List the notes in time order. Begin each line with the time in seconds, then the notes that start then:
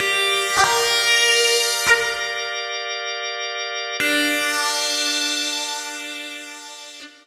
0.00 G4 A#4 D5 F5
0.64 A#4
4.00 D4 G4 A#4 D5 F5